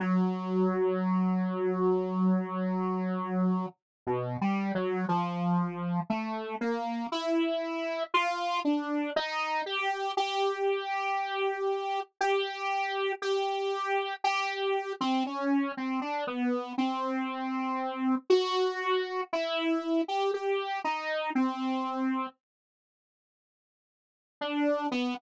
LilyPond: \new Staff { \time 5/4 \tempo 4 = 59 fis1 \tuplet 3/2 { b,8 g8 fis8 } | f4 a8 ais8 e'4 f'8 d'8 dis'8 g'8 | g'2 g'4 g'4 g'8. c'16 | cis'8 c'16 d'16 b8 c'4. fis'4 e'8. g'16 |
g'8 dis'8 c'4 r2 d'8 b16 r16 | }